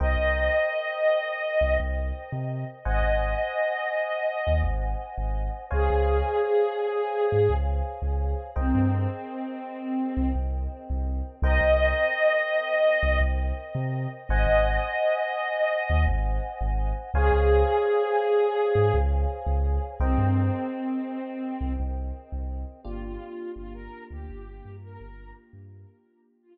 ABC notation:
X:1
M:4/4
L:1/16
Q:1/4=84
K:Cphr
V:1 name="Ocarina"
e12 z4 | e12 z4 | A12 z4 | C10 z6 |
e12 z4 | e12 z4 | A12 z4 | C10 z6 |
[K:Gphr] F F3 F B2 G4 B3 z2 | z4 F z11 |]
V:2 name="Electric Piano 1"
[Bceg]16 | [ce_ga]16 | [cdfa]16 | [Bceg]16 |
[Bceg]16 | [ce_ga]16 | [cdfa]16 | [Bceg]16 |
[K:Gphr] [B,DFG]16- | [B,DFG]16 |]
V:3 name="Synth Bass 2" clef=bass
C,, C,,8 C,, C,,3 C,3 | A,,, A,,,8 E,, A,,,3 A,,,3 | D,, D,,8 A,, D,,3 D,,3 | C,, G,,8 C,, C,,3 C,,3 |
C,, C,,8 C,, C,,3 C,3 | A,,, A,,,8 E,, A,,,3 A,,,3 | D,, D,,8 A,, D,,3 D,,3 | C,, G,,8 C,, C,,3 C,,3 |
[K:Gphr] G,,,4 G,,,3 D,, G,,,2 G,,2 G,,,3 G,,- | G,,16 |]